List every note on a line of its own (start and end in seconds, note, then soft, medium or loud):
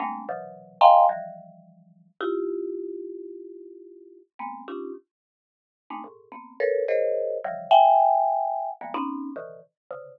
0.00 0.25 G3 medium
0.00 0.25 G#3 medium
0.00 0.25 A3 medium
0.00 0.25 A#3 medium
0.00 0.25 C4 medium
0.00 0.25 D4 medium
0.29 0.78 B2 medium
0.29 0.78 C3 medium
0.29 0.78 D3 medium
0.29 0.78 E3 medium
0.29 0.78 F#3 medium
0.81 1.06 D#5 medium
0.81 1.06 F5 medium
0.81 1.06 G5 medium
0.81 1.06 G#5 medium
0.81 1.06 A#5 medium
0.81 1.06 C6 medium
1.09 2.08 D#3 medium
1.09 2.08 E3 medium
1.09 2.08 F3 medium
1.09 2.08 G3 medium
2.21 4.19 E4 loud
2.21 4.19 F4 loud
2.21 4.19 G4 loud
4.39 4.64 G#3 medium
4.39 4.64 A#3 medium
4.39 4.64 B3 medium
4.39 4.64 C4 medium
4.68 4.93 C#4 medium
4.68 4.93 D4 medium
4.68 4.93 D#4 medium
4.68 4.93 F4 medium
4.68 4.93 G4 medium
5.90 6.03 G#3 medium
5.90 6.03 A3 medium
5.90 6.03 A#3 medium
5.90 6.03 C4 medium
5.90 6.03 D4 medium
5.90 6.03 D#4 medium
6.04 6.29 G#2 medium
6.04 6.29 A2 medium
6.04 6.29 A#2 medium
6.32 6.57 A#3 medium
6.32 6.57 B3 medium
6.32 6.57 C4 medium
6.60 6.85 A4 medium
6.60 6.85 A#4 medium
6.60 6.85 B4 medium
6.60 6.85 C#5 medium
6.88 7.38 G#4 medium
6.88 7.38 A#4 medium
6.88 7.38 C5 medium
6.88 7.38 C#5 medium
6.88 7.38 D#5 medium
7.44 7.69 C#3 medium
7.44 7.69 D3 medium
7.44 7.69 E3 medium
7.44 7.69 F3 medium
7.44 7.69 G3 medium
7.71 8.70 E5 loud
7.71 8.70 F#5 loud
7.71 8.70 G5 loud
7.71 8.70 G#5 loud
8.81 8.93 D#3 medium
8.81 8.93 F3 medium
8.81 8.93 G3 medium
8.81 8.93 G#3 medium
8.81 8.93 A#3 medium
8.81 8.93 B3 medium
8.94 9.31 B3 loud
8.94 9.31 C4 loud
8.94 9.31 C#4 loud
8.94 9.31 D#4 loud
9.36 9.61 A#2 medium
9.36 9.61 C3 medium
9.36 9.61 D3 medium
9.36 9.61 D#3 medium
9.36 9.61 E3 medium
9.91 10.19 C3 medium
9.91 10.19 C#3 medium
9.91 10.19 D3 medium